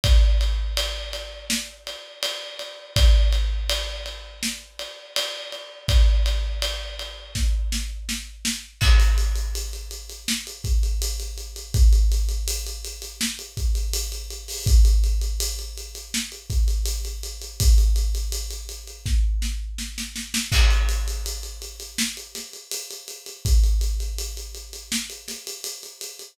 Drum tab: CC |----------------|----------------|----------------|x---------------|
RD |x-x-x-x---x-x-x-|x-x-x-x---x-x-x-|x-x-x-x---------|----------------|
HH |----------------|----------------|----------------|-xxxxxxx-xxxxxxx|
SD |--------o-------|--------o-------|--------o-o-o-o-|--------o-------|
BD |o---------------|o---------------|o-------o-------|o---------o-----|

CC |----------------|----------------|----------------|x---------------|
RD |----------------|----------------|----------------|----------------|
HH |xxxxxxxx-xxxxxxo|xxxxxxxx-xxxxxxx|xxxxxxxx--------|-xxxxxxx-xxxxxxx|
SD |--------o-------|--------o-------|--------o-o-oooo|--------o-o-----|
BD |o---------o-----|o---------o-----|o-------o-------|o---------------|

CC |----------------|
RD |----------------|
HH |xxxxxxxx-xxxxxxx|
SD |--------o-o-----|
BD |o---------------|